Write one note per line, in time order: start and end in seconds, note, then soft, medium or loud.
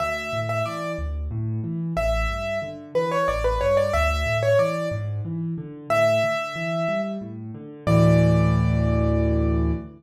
0.00 0.30 D2 medium
0.00 0.40 E5 loud
0.33 0.62 A2 medium
0.49 0.65 E5 medium
0.65 0.95 E3 medium
0.65 0.92 D5 medium
0.98 1.28 D2 medium
1.31 1.60 A2 medium
1.64 1.93 E3 medium
1.97 2.26 A1 medium
1.97 2.59 E5 medium
2.30 2.59 G2 medium
2.62 2.91 D3 medium
2.95 3.24 E3 medium
2.95 3.11 B4 medium
3.11 3.27 C#5 medium
3.28 3.58 A1 medium
3.28 3.43 D5 medium
3.44 3.60 B4 medium
3.61 3.91 G2 medium
3.61 3.76 C#5 medium
3.77 3.93 D5 medium
3.93 4.23 D2 medium
3.93 4.38 E5 loud
4.26 4.55 A2 medium
4.43 4.58 C#5 medium
4.59 4.88 E3 medium
4.59 4.88 D5 medium
4.91 5.21 G#2 medium
5.25 5.54 E3 medium
5.58 5.87 D3 medium
5.90 6.20 A2 medium
5.90 7.01 E5 loud
6.23 6.53 D3 medium
6.56 6.85 E3 medium
6.88 7.18 G3 medium
7.21 7.51 A2 medium
7.55 7.84 D3 medium
7.87 9.72 D2 loud
7.87 9.72 A2 loud
7.87 9.72 E3 loud
7.87 9.71 D5 loud